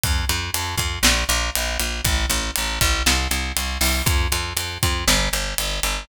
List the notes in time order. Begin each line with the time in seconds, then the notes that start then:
0.04 F2, kick, closed hi-hat
0.29 F2, closed hi-hat
0.54 F2, closed hi-hat
0.78 F2, kick, closed hi-hat
1.03 A#1, snare
1.29 A#1, closed hi-hat
1.55 A#1, closed hi-hat
1.80 A#1, closed hi-hat
2.05 A1, kick, closed hi-hat
2.30 A1, closed hi-hat
2.56 A1, closed hi-hat
2.81 A1, kick, closed hi-hat
3.06 C2, snare
3.31 C2, closed hi-hat
3.57 C2, closed hi-hat
3.81 C2, open hi-hat
4.06 F2, kick, closed hi-hat
4.32 F2, closed hi-hat
4.57 F2, closed hi-hat
4.83 F2, kick, closed hi-hat
5.08 G1, snare
5.33 G1, closed hi-hat
5.58 G1, closed hi-hat
5.83 G1, closed hi-hat